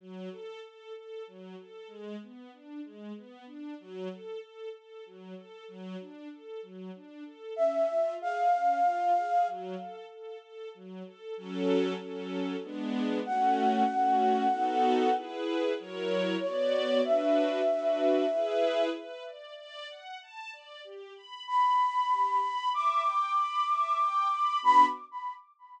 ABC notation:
X:1
M:3/4
L:1/8
Q:1/4=95
K:F#m
V:1 name="Flute"
z6 | z6 | z6 | z6 |
e2 ^e4 | z6 | z6 | f6 |
z4 c2 | e6 | [K:Bm] z6 | z2 b4 |
d'6 | b2 z4 |]
V:2 name="String Ensemble 1"
F, A A A F, A | G, B, D G, B, D | F, A A A F, A | F, D A F, D A |
C ^E G C E G | F, A A A F, A | [F,CA]2 [F,CA]2 [G,B,D]2 | [A,CF]2 [A,CF]2 [B,^DFA]2 |
[EGB]2 [F,E^Ac]2 [B,Fd]2 | [DFB]2 [DFB]2 [EGB]2 | [K:Bm] B d d f a d | G b b b G b |
e g b e g b | [B,DF]2 z4 |]